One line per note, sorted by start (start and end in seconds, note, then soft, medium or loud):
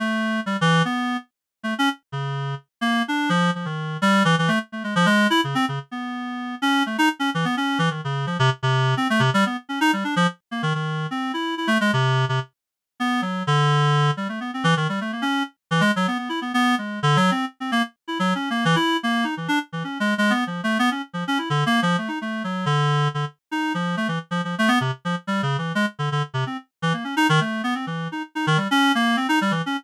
0.00 0.40 A3 medium
0.46 0.57 G3 medium
0.61 0.82 E3 loud
0.85 1.17 B3 medium
1.63 1.74 A3 medium
1.79 1.89 C#4 loud
2.12 2.55 C#3 medium
2.81 3.02 A#3 loud
3.08 3.29 D4 medium
3.29 3.51 F3 loud
3.55 3.66 F3 medium
3.65 3.97 D#3 medium
4.02 4.23 G3 loud
4.25 4.35 E3 loud
4.38 4.49 E3 loud
4.48 4.59 A3 loud
4.72 4.83 A3 soft
4.84 4.94 G#3 medium
4.96 5.06 F3 loud
5.06 5.27 G#3 loud
5.30 5.41 E4 loud
5.44 5.55 C#3 medium
5.55 5.65 C4 loud
5.68 5.79 C#3 medium
5.91 6.55 B3 medium
6.62 6.83 C#4 loud
6.86 6.97 A3 medium
6.98 7.09 D#4 loud
7.19 7.30 C#4 medium
7.34 7.45 E3 medium
7.45 7.55 B3 medium
7.57 7.78 C#4 medium
7.79 7.89 E3 loud
7.90 8.01 D#3 soft
8.04 8.26 C#3 medium
8.27 8.37 F3 medium
8.39 8.50 C3 loud
8.63 8.94 C3 loud
8.97 9.08 C4 medium
9.10 9.21 A3 loud
9.20 9.30 C3 loud
9.34 9.44 G3 loud
9.46 9.57 B3 medium
9.69 9.79 C#4 medium
9.81 9.91 D#4 loud
9.93 10.04 G3 medium
10.04 10.15 D4 medium
10.16 10.27 F3 loud
10.51 10.62 A#3 medium
10.63 10.73 D#3 medium
10.75 11.07 D#3 medium
11.11 11.32 C4 medium
11.34 11.55 E4 medium
11.57 11.68 E4 medium
11.67 11.78 A3 loud
11.81 11.91 G#3 loud
11.93 12.25 C3 loud
12.29 12.40 C3 medium
13.00 13.21 B3 medium
13.22 13.43 F#3 medium
13.47 14.11 D3 loud
14.17 14.28 G3 medium
14.29 14.39 A3 medium
14.40 14.51 B3 medium
14.54 14.64 C4 medium
14.64 14.74 E3 loud
14.77 14.87 D#3 medium
14.89 15.00 G3 medium
15.01 15.12 A3 medium
15.12 15.23 A#3 medium
15.22 15.43 C#4 medium
15.71 15.81 E3 loud
15.81 15.91 G#3 loud
15.96 16.07 F#3 medium
16.07 16.18 B3 medium
16.18 16.29 B3 medium
16.29 16.40 E4 medium
16.41 16.52 B3 medium
16.54 16.75 B3 loud
16.78 17.00 G#3 medium
17.03 17.17 D3 loud
17.16 17.31 F#3 loud
17.31 17.45 C4 medium
17.60 17.71 C4 medium
17.72 17.82 A#3 loud
18.08 18.18 E4 medium
18.19 18.34 F#3 loud
18.35 18.49 C#4 medium
18.50 18.64 A#3 medium
18.65 18.76 E3 loud
18.76 18.97 E4 medium
19.03 19.25 A#3 medium
19.24 19.35 D#4 medium
19.37 19.48 E3 medium
19.48 19.59 D4 loud
19.72 19.83 E3 medium
19.84 19.98 C#4 soft
20.00 20.14 G#3 medium
20.18 20.32 G#3 loud
20.30 20.44 B3 medium
20.47 20.61 F3 medium
20.64 20.78 A3 medium
20.79 20.90 B3 loud
20.91 21.02 C#4 medium
21.13 21.24 F3 medium
21.27 21.38 C#4 medium
21.38 21.49 E4 medium
21.50 21.64 D3 medium
21.66 21.80 A#3 loud
21.82 21.96 F3 loud
21.98 22.09 A3 medium
22.08 22.19 D#4 medium
22.21 22.43 A3 medium
22.44 22.65 F#3 medium
22.66 23.08 D3 loud
23.14 23.25 D3 medium
23.51 23.73 D#4 medium
23.74 23.96 F3 medium
23.97 24.07 A3 medium
24.08 24.19 E3 medium
24.31 24.41 F3 medium
24.44 24.55 F3 medium
24.59 24.69 A3 loud
24.68 24.79 B3 loud
24.81 24.91 C3 medium
25.05 25.15 F3 medium
25.27 25.41 G3 medium
25.43 25.57 C#3 medium
25.58 25.72 E3 medium
25.75 25.86 G#3 loud
25.99 26.09 D3 medium
26.12 26.22 D3 medium
26.34 26.44 C3 medium
26.46 26.57 C4 medium
26.82 26.93 E3 medium
26.93 27.04 A#3 soft
27.04 27.15 C#4 medium
27.17 27.27 D#4 loud
27.29 27.40 D#3 loud
27.41 27.62 A3 medium
27.64 27.74 B3 medium
27.75 27.86 C4 medium
27.87 28.08 E3 medium
28.12 28.22 D#4 medium
28.35 28.46 D#4 medium
28.47 28.57 D#3 loud
28.57 28.68 G3 medium
28.71 28.92 C#4 loud
28.95 29.16 A#3 loud
29.17 29.27 C4 medium
29.29 29.39 D#4 loud
29.41 29.52 G3 medium
29.51 29.62 E3 medium
29.66 29.77 C#4 medium